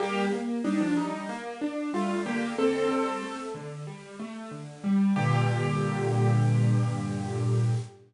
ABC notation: X:1
M:4/4
L:1/16
Q:1/4=93
K:Gm
V:1 name="Acoustic Grand Piano"
[B,G]2 z2 [G,E] [F,D] [G,E]2 z4 [A,F]2 [B,G]2 | [CA]6 z10 | G16 |]
V:2 name="Acoustic Grand Piano"
G,2 B,2 D2 z2 B,2 D2 G,2 D,2- | D,2 G,2 A,2 D,2 G,2 A,2 D,2 G,2 | [G,,B,,D,]16 |]